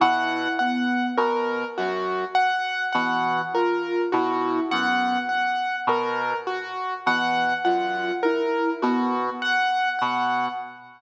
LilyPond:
<<
  \new Staff \with { instrumentName = "Brass Section" } { \clef bass \time 3/4 \tempo 4 = 51 b,8 r8 b,8 ges,8 r8 b,8 | r8 b,8 ges,8 r8 b,8 r8 | b,8 ges,8 r8 b,8 r8 b,8 | }
  \new Staff \with { instrumentName = "Ocarina" } { \time 3/4 e'8 b8 r4. e8 | f'8 e'8 b8 r4. | e8 f'8 e'8 b8 r4 | }
  \new Staff \with { instrumentName = "Acoustic Grand Piano" } { \time 3/4 ges''8 ges''8 bes'8 ges'8 ges''8 ges''8 | bes'8 ges'8 ges''8 ges''8 bes'8 ges'8 | ges''8 ges''8 bes'8 ges'8 ges''8 ges''8 | }
>>